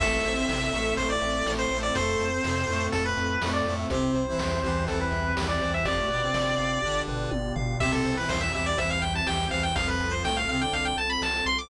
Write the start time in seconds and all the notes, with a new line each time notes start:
0.00 A1 A3 C4 E4 A4 E5, kick, crash
0.24 A1 C5, closed hi-hat
0.36 C4 C5
0.49 A1 C3 C4 E5, snare
0.72 A1 A2 A3 A4, closed hi-hat
0.97 A1 A2 A3 C5, kick, closed hi-hat
1.10 D5
1.21 A1 E5, closed hi-hat
1.46 A1 A2 A3 A4, snare
1.59 C5
1.71 A1 A2 A3 C5, closed hi-hat
1.83 D5
1.95 F2 A3 C4 F4 A4 C5, kick, closed hi-hat
2.19 F2, closed hi-hat
2.33 C4 C5
2.44 F2 C3 C4, snare
2.68 F2 A2 A3, closed hi-hat
2.92 F2 A2 A3 A4, kick, closed hi-hat
3.05 B4
3.17 F2, closed hi-hat
3.42 F2 A2 A3, snare
3.53 D5
3.65 F2 A2 A3, closed hi-hat
3.79 E5
3.89 C2 C3 C4 E4 G4 C5, kick, closed hi-hat
4.15 C2 C5, closed hi-hat
4.28 E3 E4
4.38 C2 E2 E3 E5, snare
4.63 C2 E2 E3 G4, closed hi-hat
4.87 C2 E2 E3 A4 C5, kick, closed hi-hat
5.01 B4
5.11 C2 E5, closed hi-hat
5.36 C2 E2 E3 G4, snare
5.48 D5
5.61 C2 E2 E3 C5, closed hi-hat
5.74 E5
5.85 G1 F2 F3 B3 D4 F4 G4 D5, kick, closed hi-hat
5.97 A2 A3
6.08 G1 B2 B3 B4, closed hi-hat
6.22 C3 C4
6.34 G1 D5, snare
6.57 G1 F5, closed hi-hat
6.82 G1 D3 D4 G4, kick
7.08 G1 B4, floor tom
7.31 G1 D5, high tom
7.56 G1 F5, floor tom
7.80 C2 C3 C4 E4 G4 E5, kick, crash
7.92 A4
8.05 C2 C5, closed hi-hat
8.17 E3 E4 B4
8.29 C2 E2 E3 C5 E5, snare
8.41 E5
8.53 C2 E2 E3 G4 E5, closed hi-hat
8.66 D5
8.77 C2 E2 E3 C5 E5, kick, closed hi-hat
8.90 F5
9.02 C2 E5 G5, closed hi-hat
9.15 A5
9.26 C2 E2 E3 G4 G5, snare
9.50 C2 E2 E3 C5 F5, closed hi-hat
9.63 G5
9.76 C2 F2 F3 C4 F4 A4 F5, kick, closed hi-hat
9.88 B4
10.00 C2, closed hi-hat
10.11 C5
10.23 C2 A2 A3 G5, snare
10.37 F5
10.48 C2 C3 C4 F5, closed hi-hat
10.60 D3 D4 G5
10.73 C2 F5, kick, closed hi-hat
10.85 G5
10.97 C2 A5, closed hi-hat
11.10 B5
11.22 C2 A5, snare
11.46 C2 C6, closed hi-hat
11.59 D6